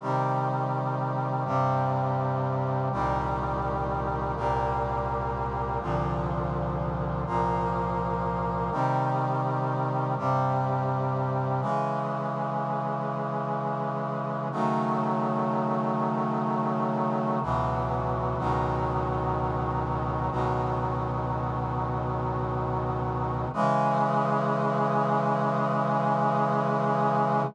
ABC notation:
X:1
M:3/4
L:1/8
Q:1/4=62
K:Cm
V:1 name="Brass Section"
[C,E,G,]3 [G,,C,G,]3 | [C,,B,,E,G,]3 [C,,B,,G,B,]3 | [C,,B,,D,F,]3 [C,,B,,F,B,]3 | [C,E,G,]3 [G,,C,G,]3 |
[K:C#m] [C,E,G,]6 | [C,D,F,A,]6 | [C,,B,,E,F,]2 [C,,B,,D,F,]4 | "^rit." [C,,B,,D,F,]6 |
[C,E,G,]6 |]